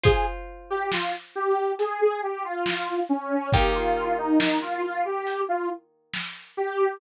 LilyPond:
<<
  \new Staff \with { instrumentName = "Lead 2 (sawtooth)" } { \time 4/4 \key ees \mixolydian \tempo 4 = 69 aes'16 r8 g'16 f'16 r16 g'8 aes'16 aes'16 g'16 f'8. des'8 | g'16 f'8 ees'16 ees'16 f'16 f'16 g'8 f'16 r4 g'8 | }
  \new Staff \with { instrumentName = "Acoustic Guitar (steel)" } { \time 4/4 \key ees \mixolydian <f' c'' aes''>1 | <ees bes g'>1 | }
  \new DrumStaff \with { instrumentName = "Drums" } \drummode { \time 4/4 <hh bd>4 sn4 hh4 sn4 | <hh bd>4 sn4 hh4 sn4 | }
>>